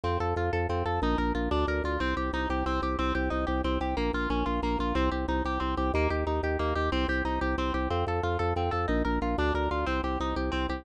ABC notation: X:1
M:6/8
L:1/8
Q:3/8=122
K:Cm
V:1 name="Orchestral Harp"
C =A F A C A | E B F D B F | C G E G C G | C G E G C G |
B, F _D F B, F | C G E G C G | B, G E G B, G | C G E G C G |
C =A F A C A | E B F D B F | C G E G C G |]
V:2 name="Drawbar Organ" clef=bass
F,, F,, F,, F,, F,, F,, | B,,, B,,, B,,, D,, D,, D,, | C,, C,, C,, C,, C,, C,, | C,, C,, C,, C,, C,, C,, |
B,,, B,,, B,,, B,,, B,,, B,,, | C,, C,, C,, C,, C,, C,, | E,, E,, E,, E,, E,, E,, | C,, C,, C,, C,, C,, C,, |
F,, F,, F,, F,, F,, F,, | B,,, B,,, B,,, D,, D,, D,, | C,, C,, C,, C,, C,, C,, |]